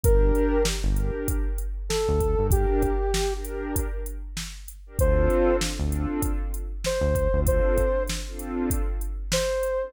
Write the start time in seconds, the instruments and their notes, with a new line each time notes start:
0.03 synth bass 1 G1, pad 2 (warm) D4 G4 A#4, ocarina A#4, kick, closed hi-hat
0.35 closed hi-hat
0.65 snare
0.84 synth bass 1 G1, pad 2 (warm) D4 G4 A#4
0.97 closed hi-hat
1.28 kick, closed hi-hat
1.58 closed hi-hat
1.89 ocarina A4, snare
2.09 synth bass 1 D2
2.20 kick, closed hi-hat
2.38 synth bass 1 G2, pad 2 (warm) D4 G4 A#4
2.51 ocarina G4, kick, closed hi-hat
2.82 kick, closed hi-hat
3.14 snare
3.32 pad 2 (warm) D4 G4 A#4
3.45 closed hi-hat
3.76 kick, closed hi-hat
4.06 closed hi-hat
4.37 snare
4.68 closed hi-hat
4.86 pad 2 (warm) D4 G4 A#4
4.98 synth bass 1 D2, pad 2 (warm) C4 D4 F4 A4, ocarina C5, kick, closed hi-hat
5.30 closed hi-hat
5.61 snare
5.79 synth bass 1 D2, pad 2 (warm) C4 D4 F4 A4
5.92 closed hi-hat
6.22 kick, closed hi-hat
6.54 closed hi-hat
6.84 ocarina C5, snare
7.01 synth bass 1 D2
7.15 kick, closed hi-hat
7.33 synth bass 1 D2, pad 2 (warm) C4 D4 F4 A4
7.47 ocarina C5, kick, closed hi-hat
7.78 kick, closed hi-hat
8.07 snare, closed hi-hat
8.27 pad 2 (warm) C4 D4 F4 A4
8.39 closed hi-hat
8.70 kick, closed hi-hat
9.01 closed hi-hat
9.32 ocarina C5, snare
9.63 closed hi-hat
9.82 pad 2 (warm) C4 D4 F4 A4